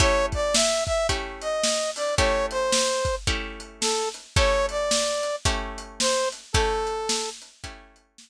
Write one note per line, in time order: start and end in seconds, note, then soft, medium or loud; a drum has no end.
0.00 1.00 A3 medium
0.00 1.00 C#4 medium
0.00 1.00 E4 medium
0.00 1.00 G4 medium
0.00 0.26 C#5 loud
0.00 kick loud
0.00 closed hi-hat loud
0.32 0.55 D5 medium
0.32 kick medium
0.32 closed hi-hat medium
0.54 0.84 E5 medium
0.54 snare loud
0.86 1.07 E5 loud
0.86 kick medium
0.86 closed hi-hat medium
1.09 2.09 A3 medium
1.09 2.09 C#4 medium
1.09 2.09 E4 medium
1.09 2.09 G4 medium
1.09 kick medium
1.09 closed hi-hat loud
1.41 1.91 D#5 medium
1.41 closed hi-hat medium
1.64 snare loud
1.96 2.15 D5 medium
1.96 open hi-hat medium
2.17 3.18 A3 medium
2.17 3.18 C#4 medium
2.17 3.18 E4 medium
2.17 3.18 G4 medium
2.17 2.46 C#5 medium
2.17 kick loud
2.17 closed hi-hat loud
2.51 3.15 C5 medium
2.51 closed hi-hat medium
2.72 snare loud
3.05 kick medium
3.05 closed hi-hat medium
3.27 4.28 A3 medium
3.27 4.28 C#4 medium
3.27 4.28 E4 medium
3.27 4.28 G4 medium
3.27 kick medium
3.27 closed hi-hat medium
3.60 closed hi-hat medium
3.81 4.09 A4 medium
3.81 snare loud
4.14 closed hi-hat medium
4.36 5.37 A3 medium
4.36 5.37 C#4 medium
4.36 5.37 E4 medium
4.36 5.37 G4 medium
4.36 4.66 C#5 loud
4.36 kick loud
4.36 closed hi-hat loud
4.69 5.36 D5 medium
4.69 closed hi-hat medium
4.91 snare loud
5.23 closed hi-hat medium
5.45 6.46 A3 medium
5.45 6.46 C#4 medium
5.45 6.46 E4 medium
5.45 6.46 G4 medium
5.45 kick loud
5.45 closed hi-hat loud
5.78 closed hi-hat medium
6.00 6.29 C5 loud
6.00 snare loud
6.32 closed hi-hat medium
6.53 7.55 A3 medium
6.53 7.55 C#4 medium
6.53 7.55 E4 medium
6.53 7.55 G4 medium
6.53 7.30 A4 loud
6.53 kick loud
6.53 closed hi-hat loud
6.87 closed hi-hat medium
7.09 snare loud
7.42 closed hi-hat medium
7.64 8.30 A3 medium
7.64 8.30 C#4 medium
7.64 8.30 E4 medium
7.64 8.30 G4 medium
7.64 kick medium
7.64 closed hi-hat loud
7.96 closed hi-hat medium
8.18 snare loud